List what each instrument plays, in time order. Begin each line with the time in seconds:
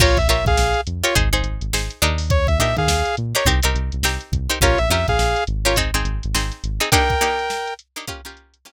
0.00 synth bass 1 A#1, pizzicato strings F4 G4 A#4 C#5, lead 2 (sawtooth) F4 C#5, kick, crash
0.17 synth bass 1 A#1, lead 2 (sawtooth) E5, kick, closed hi-hat
0.28 synth bass 1 A#1, pizzicato strings F4 G4 A#4 C#5, lead 2 (sawtooth) E5, closed hi-hat
0.45 synth bass 1 A#1, lead 2 (sawtooth) G#4 F5, kick, closed hi-hat
0.57 synth bass 1 A#1, snare
0.74 closed hi-hat
0.87 synth bass 1 F2, closed hi-hat
1.03 pizzicato strings F4 G4 A#4 C#5, lead 2 (sawtooth) F4 C#5, closed hi-hat
1.15 synth bass 1 G#1, pizzicato strings D#4 G#4 C5, kick, closed hi-hat
1.33 synth bass 1 G#1, pizzicato strings D#4 G#4 C5, closed hi-hat
1.43 synth bass 1 G#1, closed hi-hat
1.61 synth bass 1 G#1, closed hi-hat
1.73 synth bass 1 G#1, pizzicato strings D#4 G#4 C5, snare
1.90 closed hi-hat
2.02 synth bass 1 D#2, pizzicato strings D4 D#4 G4 A#4, closed hi-hat
2.18 open hi-hat
2.30 lead 2 (sawtooth) C#5, kick, closed hi-hat
2.47 synth bass 1 D#2, lead 2 (sawtooth) E5, kick, closed hi-hat
2.59 synth bass 1 A#2, pizzicato strings D4 D#4 G4 A#4, lead 2 (sawtooth) E5, closed hi-hat
2.76 synth bass 1 D#3, lead 2 (sawtooth) G#4 F5, kick, closed hi-hat
2.87 synth bass 1 D#2, snare
3.05 closed hi-hat
3.17 synth bass 1 A#2, closed hi-hat
3.35 pizzicato strings D4 D#4 G4 A#4, lead 2 (sawtooth) C#5, closed hi-hat
3.45 synth bass 1 C2, pizzicato strings C4 D#4 G4 A#4, kick
3.63 synth bass 1 C2, pizzicato strings C4 D#4 G4 A#4, closed hi-hat
3.75 synth bass 1 C2, closed hi-hat
3.92 synth bass 1 C2, closed hi-hat
4.03 synth bass 1 C2, pizzicato strings C4 D#4 G4 A#4, snare
4.21 closed hi-hat
4.32 synth bass 1 C2, kick, closed hi-hat
4.50 pizzicato strings C4 D#4 G4 A#4, closed hi-hat
4.61 synth bass 1 A#1, pizzicato strings C#4 F4 G4 A#4, lead 2 (sawtooth) F4 C#5, kick, closed hi-hat
4.78 synth bass 1 A#1, lead 2 (sawtooth) E5, closed hi-hat
4.90 synth bass 1 F2, pizzicato strings C#4 F4 G4 A#4, lead 2 (sawtooth) E5, closed hi-hat
5.08 synth bass 1 A#1, lead 2 (sawtooth) G#4 F5, kick, snare, closed hi-hat
5.19 synth bass 1 A#1, snare
5.36 closed hi-hat
5.47 synth bass 1 G#1, closed hi-hat
5.65 pizzicato strings C#4 F4 G4 A#4, lead 2 (sawtooth) F4 C#5, closed hi-hat
5.76 pizzicato strings C4 D#4 G#4, kick, closed hi-hat
5.94 synth bass 1 G#1, pizzicato strings C4 D#4 G#4, closed hi-hat
6.04 synth bass 1 G#1, closed hi-hat
6.23 synth bass 1 G#1, closed hi-hat
6.34 synth bass 1 G#1, pizzicato strings C4 D#4 G#4, snare
6.52 snare, closed hi-hat
6.64 synth bass 1 G#1, closed hi-hat
6.80 pizzicato strings C4 D#4 G#4, closed hi-hat
6.92 pizzicato strings A#3 D4 D#4 G4, lead 2 (sawtooth) A#4 G5, kick, closed hi-hat
7.09 kick, snare, closed hi-hat
7.21 pizzicato strings A#3 D4 D#4 G4, closed hi-hat
7.39 closed hi-hat
7.50 snare
7.67 closed hi-hat
7.79 closed hi-hat
7.96 pizzicato strings A#3 D4 D#4 G4, closed hi-hat
8.07 pizzicato strings A#3 C#4 F4 G4, kick, closed hi-hat
8.25 pizzicato strings A#3 C#4 F4 G4, closed hi-hat
8.37 closed hi-hat
8.54 closed hi-hat
8.65 pizzicato strings A#3 C#4 F4 G4, snare